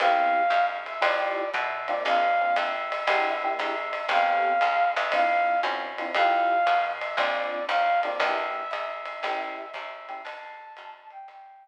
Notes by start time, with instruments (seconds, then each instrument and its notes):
0.00 electric bass (finger) C2, electric piano 1 B3 C4 E4 G4, flute F5, ride
0.50 electric bass (finger) F#2, hi-hat pedal, ride
0.86 flute E5, ride
1.01 electric bass (finger) F2, electric piano 1 A3 E4 F4 G4, flute D5, ride
1.54 electric bass (finger) B2, flute E5, kick, hi-hat pedal, ride
1.88 electric piano 1 A#3 C4 D4 F4, flute D5, ride
2.05 electric bass (finger) A#1, flute F5, ride
2.41 electric piano 1 A#3 C4 D4 F4
2.56 electric bass (finger) F2, flute E5, hi-hat pedal, ride
2.92 ride
3.07 electric bass (finger) E2, electric piano 1 A#3 D4 E4 G4, ride
3.44 electric piano 1 A#3 D4 E4 G4
3.59 electric bass (finger) G#2, flute E5, hi-hat pedal, ride
3.93 ride
4.09 electric bass (finger) A1, electric piano 1 B3 C4 G4 A4, flute F5, ride
4.61 electric bass (finger) C#2, hi-hat pedal, ride
4.96 electric bass (finger) D2, flute E5, ride
5.12 electric piano 1 C4 D4 E4 F4, flute F5, kick, ride
5.63 electric bass (finger) F#2, electric piano 1 C4 D4 E4 F4, hi-hat pedal, ride
5.98 electric piano 1 C4 D4 E4 F4, ride
6.15 electric bass (finger) F2, electric piano 1 A3 E4 F4 G4, flute F5, ride
6.67 electric bass (finger) B2, hi-hat pedal, ride
7.01 flute E5, ride
7.17 electric bass (finger) A#1, electric piano 1 A#3 C4 D4 F4, flute D5, kick, ride
7.68 electric bass (finger) D#2, flute F5, hi-hat pedal, ride
8.03 electric piano 1 A#3 C4 D4 F4, flute D5, ride
8.20 electric bass (finger) E2, electric piano 1 A#3 D4 E4 G4, flute E5, kick, ride
8.71 electric bass (finger) G#2, flute E5, hi-hat pedal, ride
9.05 ride
9.23 electric bass (finger) A1, electric piano 1 A3 C#4 E4 G4, ride
9.74 electric bass (finger) D#2, flute E5, kick, hi-hat pedal, ride
10.09 electric piano 1 A3 C#4 E4 G4, ride
10.24 electric bass (finger) D2, flute A5, ride
10.77 electric bass (finger) F#2, hi-hat pedal, ride
11.10 flute G5, ride
11.28 electric bass (finger) G1, flute G5, kick, ride